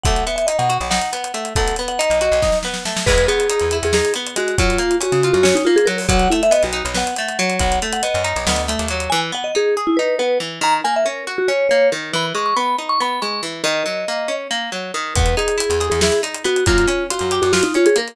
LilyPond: <<
  \new Staff \with { instrumentName = "Vibraphone" } { \time 7/8 \key e \lydian \tempo 4 = 139 fis''8 e''16 e''16 dis''16 fis''8 r16 fis''4. | fis''8 r16 fis''16 dis''4. r4 | b'8 gis'4~ gis'16 gis'16 gis'8 r8 fis'8 | eis'4 fis'8. fis'16 fis'16 dis'16 eis'16 gis'16 ais'16 r16 |
fis''8 e'16 e''16 dis''16 fis'8 r16 fis''4. | fis''8 r16 fis''16 dis''4. r4 | gis''16 r16 fis''16 dis''16 gis'8 r16 e'16 b'8 b'8 r8 | ais''16 r16 gis''16 e''16 ais'8 r16 fis'16 cis''8 cis''8 r8 |
b''16 r16 cis'''16 cis'''16 b''8 r16 cis'''16 b''8 cis'''8 r8 | dis''2 r4. | b'8 gis'4~ gis'16 gis'16 gis'8 r8 fis'8 | eis'4 fis'8. fis'16 fis'16 dis'16 eis'16 gis'16 ais'16 r16 | }
  \new Staff \with { instrumentName = "Acoustic Guitar (steel)" } { \time 7/8 \key e \lydian a8 b8 dis'8 fis'8 dis'8 b8 a8 | a8 b8 dis'8 fis'8 dis'8 b8 a8 | gis8 b8 dis'8 e'8 dis'8 b8 gis8 | fis8 ais8 cis'8 eis'8 cis'8 ais8 fis8 |
fis8 a8 b8 dis'8 b8 a8 fis8~ | fis8 a8 b8 dis'8 b8 a8 fis8 | e8 b8 dis'8 gis'8 dis'8 b8 e8 | dis8 ais8 cis'8 fis'8 cis'8 ais8 dis8 |
e8 gis8 b8 dis'8 b8 gis8 e8 | dis8 fis8 ais8 cis'8 ais8 fis8 dis8 | b8 dis'8 e'8 gis'8 e'8 dis'8 b8 | ais8 cis'8 eis'8 g'8 eis'8 cis'8 ais8 | }
  \new Staff \with { instrumentName = "Electric Bass (finger)" } { \clef bass \time 7/8 \key e \lydian b,,4~ b,,16 b,8 b,,4.~ b,,16 | b,,4~ b,,16 b,,8 b,,4.~ b,,16 | e,4~ e,16 e,8 e,4.~ e,16 | fis,4~ fis,16 cis8 fis,4.~ fis,16 |
b,,4~ b,,16 b,,8 b,,4.~ b,,16 | b,,4~ b,,16 fis,8 b,,16 d,8. dis,8. | r2. r8 | r2. r8 |
r2. r8 | r2. r8 | e,4~ e,16 e,8 e,4.~ e,16 | fis,4~ fis,16 fis,8 fis,4.~ fis,16 | }
  \new DrumStaff \with { instrumentName = "Drums" } \drummode { \time 7/8 <hh bd>16 hh16 hh16 hh16 hh16 hh16 hh16 hh16 sn16 hh16 hh16 hh16 hh16 hh16 | <hh bd>16 hh16 hh16 hh16 hh16 hh16 hh16 hh16 <bd sn>16 sn16 sn16 sn16 sn16 sn16 | <cymc bd>16 hh16 hh16 hh16 hh16 hh16 hh16 hh16 sn16 hh16 hh16 hh16 hh16 hh16 | <hh bd>16 hh16 hh16 hh16 hh16 hh16 hh16 hh16 sn16 hh8 hh16 hh16 hho16 |
<hh bd>16 hh16 hh16 hh16 hh16 hh16 hh16 hh16 sn16 hh16 hh16 hh16 hh16 hh16 | <hh bd>16 hh16 hh16 hh16 hh16 hh16 hh16 hh16 sn16 hh16 hh16 hh16 hh16 hh16 | r4 r4 r4. | r4 r4 r4. |
r4 r4 r4. | r4 r4 r4. | <hh bd>16 hh16 hh16 hh16 hh16 hh16 hh16 hh16 sn16 hh16 hh16 hh16 hh16 hh16 | <hh bd>16 hh16 hh8 hh16 hh16 hh16 hh16 sn16 hh16 hh16 hh16 hh16 hh16 | }
>>